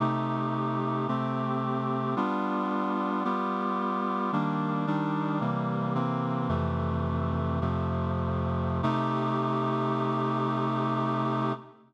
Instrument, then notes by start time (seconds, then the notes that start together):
clarinet
0.00 C3 A3 D#4 G4
1.08 C3 A3 C4 G4
2.16 G3 B3 D4 F4
3.24 G3 B3 F4 G4
4.32 D#3 G3 A#3 D4
4.87 D#3 G3 D4 D#4
5.41 C3 E3 G3 A#3
5.95 C3 E3 A#3 C4
6.49 F2 C3 E3 A3
7.61 F2 C3 F3 A3
8.83 C3 A3 D#4 G4